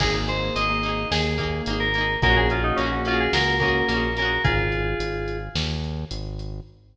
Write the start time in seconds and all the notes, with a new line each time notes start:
0.00 G#1 A#3 D#4 G#4, kick, crash
0.05 G#4
0.14 A#3 D#4 G#4
0.28 A#3 D#4 G#4 C5, closed hi-hat
0.55 G#1 A#3 D#4 D#5, closed hi-hat
0.61 G#4
0.69 A#3 D#4 G#4
0.83 A#3 D#4, closed hi-hat
0.89 G#4
1.11 D#2 A#3 D#4 G#4, snare
1.38 A#3 D#4 G#4, kick, closed hi-hat
1.43 G#4
1.66 G#1 A#3, closed hi-hat
1.70 D#4 G#4
1.80 A#4
1.94 A#3 D#4, closed hi-hat
2.01 G#4
2.22 A#1 A#3 C#4 F#4 G#4 A#4, kick, closed hi-hat
2.29 F#4 G#4
2.36 A#3 C#4 F#4 G#4
2.50 A#3 C#4 F4 F#4 G#4, closed hi-hat
2.63 D#4
2.76 A#1 A#3 C#4, closed hi-hat
2.81 C#4 F#4
2.86 G#4
2.92 A#3 C#4 F#4 G#4
3.05 A#3 C#4 F4, closed hi-hat
3.11 F#4 G#4
3.20 G#4
3.33 C#2 A#3 C#4 F#4 G#4 A#4, snare
3.60 A#3 C#4 F#4 G#4 A#4, kick, closed hi-hat
3.65 F#4 G#4
3.88 A#1 A#3 C#4, closed hi-hat
3.94 F#4 G#4
4.17 A#3 C#4 A#4, closed hi-hat
4.22 F#4 G#4
4.44 G#1 F4 G#4, kick, closed hi-hat
4.72 closed hi-hat
4.99 G#1, closed hi-hat
5.28 closed hi-hat
5.55 D#2, snare
5.84 closed hi-hat
6.11 G#1, closed hi-hat
6.39 closed hi-hat